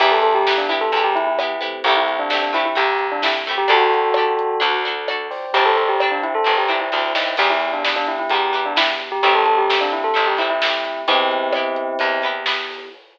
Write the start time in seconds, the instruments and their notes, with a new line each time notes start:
0.00 electric bass (finger) E2, pizzicato strings B3 E4 G4, electric piano 1 B3 E4 G4, tubular bells G4, kick, crash
0.11 tubular bells A4
0.22 tubular bells A4, closed hi-hat
0.35 tubular bells G4
0.47 pizzicato strings B3 E4 G4, snare
0.58 tubular bells D4
0.69 pizzicato strings B3 E4 G4, tubular bells E4, closed hi-hat
0.81 tubular bells A4
0.92 electric bass (finger) E2, pizzicato strings B3 E4, closed hi-hat
0.97 pizzicato strings G4
1.04 tubular bells G4
1.15 tubular bells E4, closed hi-hat
1.27 tubular bells E4
1.39 pizzicato strings B3 E4 G4, cross-stick
1.61 electric piano 1 A3 C4 E4 G4, pizzicato strings B3 E4 G4, closed hi-hat
1.84 electric bass (finger) C2, pizzicato strings A3 C4, tubular bells G4, kick, closed hi-hat
1.88 pizzicato strings E4 G4
1.96 tubular bells E4
2.08 closed hi-hat
2.19 tubular bells D4
2.30 pizzicato strings A3 C4 E4, tubular bells D4, snare
2.34 pizzicato strings G4
2.42 tubular bells D4
2.53 pizzicato strings A3 C4 E4 G4, tubular bells E4, closed hi-hat
2.65 tubular bells E4
2.75 electric bass (finger) C2, pizzicato strings A3 C4 E4 G4, tubular bells G4, closed hi-hat
2.99 closed hi-hat
3.12 tubular bells D4
3.22 pizzicato strings A3 C4 E4 G4, tubular bells E4, snare
3.46 pizzicato strings A3 C4 E4, closed hi-hat
3.51 pizzicato strings G4
3.58 tubular bells G4
3.68 electric bass (finger) D2, pizzicato strings D4 G4 A4, tubular bells F#4 A4, electric piano 1 A4 D5 G5, kick, closed hi-hat
3.94 closed hi-hat
4.14 pizzicato strings D4 G4, cross-stick
4.19 pizzicato strings A4
4.39 closed hi-hat
4.60 electric bass (finger) D2, pizzicato strings D4 F#4 A4, electric piano 1 A4 D5 F#5, closed hi-hat
4.85 pizzicato strings D4 F#4 A4, closed hi-hat
5.08 pizzicato strings D4 F#4 A4, cross-stick
5.30 electric piano 1 C5 D5 G5, open hi-hat
5.53 electric bass (finger) G1, pizzicato strings C4 D4, tubular bells G4, kick, closed hi-hat
5.57 pizzicato strings G4
5.65 tubular bells A4
5.77 tubular bells A4, closed hi-hat
5.89 tubular bells G4
6.00 pizzicato strings C4 D4 G4, cross-stick
6.12 tubular bells D4
6.23 tubular bells E4, closed hi-hat
6.35 tubular bells A4
6.44 electric bass (finger) G1, pizzicato strings C4 D4 G4, closed hi-hat
6.58 tubular bells G4
6.68 pizzicato strings C4 D4 G4, tubular bells E4, closed hi-hat
6.81 tubular bells E4
6.92 electric bass (finger) D2, pizzicato strings C4 D4 G4, kick, snare
7.15 electric bass (finger) D#2, snare
7.37 electric bass (finger) E2, pizzicato strings B3 E4 G4, electric piano 1 B3 E4 G4, tubular bells G4, kick, crash
7.50 tubular bells E4
7.61 closed hi-hat
7.73 tubular bells D4
7.85 pizzicato strings B3 E4 G4, tubular bells D4, snare
7.96 tubular bells D4
8.07 tubular bells E4, closed hi-hat
8.19 tubular bells E4
8.30 electric bass (finger) E2, pizzicato strings B3 E4, tubular bells G4, closed hi-hat
8.35 pizzicato strings G4
8.53 pizzicato strings B3 E4 G4, closed hi-hat
8.65 tubular bells D4
8.76 pizzicato strings B3 E4 G4, tubular bells E4, snare
9.00 closed hi-hat
9.12 tubular bells G4
9.23 electric bass (finger) A1, pizzicato strings A3 C4 E4 G4, electric piano 1 A3 C4 E4 G4, tubular bells G4, kick, closed hi-hat
9.35 tubular bells A4
9.45 tubular bells A4, closed hi-hat
9.58 tubular bells G4
9.70 pizzicato strings A3 C4 E4 G4, snare
9.81 tubular bells D4
9.92 tubular bells E4, closed hi-hat
10.04 tubular bells A4
10.14 electric bass (finger) A1, pizzicato strings A3 C4 E4 G4, closed hi-hat
10.27 tubular bells G4
10.37 pizzicato strings A3 C4 E4, tubular bells E4, closed hi-hat
10.42 pizzicato strings G4
10.50 tubular bells E4
10.62 pizzicato strings A3 C4 E4, snare
10.66 pizzicato strings G4
10.85 closed hi-hat
11.07 electric bass (finger) E2, electric piano 1 B3 E4 G4, pizzicato strings B3 E4 G4, tubular bells C4 E4, kick, closed hi-hat
11.31 closed hi-hat
11.53 pizzicato strings B3 E4, cross-stick
11.57 pizzicato strings G4
11.76 closed hi-hat
11.99 electric bass (finger) E2, pizzicato strings B3 E4 G4, closed hi-hat
12.22 pizzicato strings B3 E4 G4, closed hi-hat
12.46 pizzicato strings B3 E4 G4, snare
12.70 open hi-hat